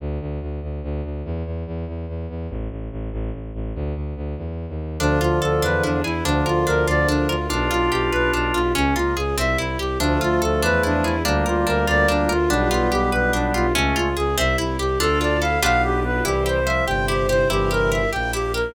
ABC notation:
X:1
M:6/8
L:1/16
Q:3/8=96
K:Dm
V:1 name="Clarinet"
z12 | z12 | z12 | z12 |
D2 F2 A2 =B2 D2 E2 | D2 F2 B2 d2 D2 F2 | D2 F2 G2 =B2 D2 F2 | ^C2 ^E2 ^G2 =e2 =E2 =G2 |
D2 F2 A2 =B2 D2 E2 | D2 F2 B2 d2 D2 F2 | D2 F2 G2 =B2 D2 F2 | ^C2 ^E2 ^G2 =e2 =E2 =G2 |
A2 d2 f2 f2 G2 =B2 | G2 c2 e2 g2 G2 c2 | G2 B2 e2 g2 G2 B2 |]
V:2 name="Drawbar Organ"
z12 | z12 | z12 | z12 |
[D,F,]12 | [D,F,]12 | [DF]12 | ^C2 B,2 z8 |
[F,A,]12 | [G,B,]12 | [G,=B,]12 | [A,^C]4 z8 |
[DF]4 E2 =B,4 B,2 | [E,G,]4 F,2 C,4 C,2 | [C,E,]6 z6 |]
V:3 name="Harpsichord"
z12 | z12 | z12 | z12 |
D2 F2 A2 D2 E2 ^G2 | D2 B2 D2 F2 D2 B2 | D2 F2 G2 =B2 D2 F2 | ^C2 ^E2 ^G2 =C2 =E2 =G2 |
D2 F2 A2 D2 E2 ^G2 | D2 B2 D2 F2 D2 B2 | D2 F2 G2 =B2 D2 F2 | ^C2 ^E2 ^G2 =C2 =E2 =G2 |
D2 F2 A2 [DFG=B]6 | E2 G2 c2 G2 E2 G2 | E2 G2 B2 G2 E2 G2 |]
V:4 name="Violin" clef=bass
D,,2 D,,2 D,,2 D,,2 D,,2 D,,2 | E,,2 E,,2 E,,2 E,,2 E,,2 E,,2 | A,,,2 A,,,2 A,,,2 A,,,2 A,,,2 A,,,2 | D,,2 D,,2 D,,2 E,,3 _E,,3 |
D,,2 D,,2 D,,2 E,,2 E,,2 E,,2 | D,,2 D,,2 D,,2 D,,2 D,,2 D,,2 | =B,,,2 B,,,2 B,,,2 B,,,2 B,,,2 B,,,2 | ^C,,2 C,,2 C,,2 =C,,2 C,,2 C,,2 |
D,,2 D,,2 D,,2 E,,2 E,,2 E,,2 | D,,2 D,,2 D,,2 D,,2 D,,2 D,,2 | =B,,,2 B,,,2 B,,,2 B,,,2 B,,,2 B,,,2 | ^C,,2 C,,2 C,,2 =C,,2 C,,2 C,,2 |
D,,6 =B,,,6 | C,,6 G,,,6 | G,,,6 B,,,6 |]
V:5 name="String Ensemble 1"
z12 | z12 | z12 | z12 |
[DFA]6 [DE^G=B]6 | [DFB]12 | [DFG=B]12 | [^C^E^G]6 [=C=E=G]6 |
[DFA]6 [DE^G=B]6 | [DFB]12 | [DFG=B]12 | [^C^E^G]6 [=C=E=G]6 |
[DFA]6 [DFG=B]6 | [EGc]6 [CEc]6 | [EGB]6 [B,EB]6 |]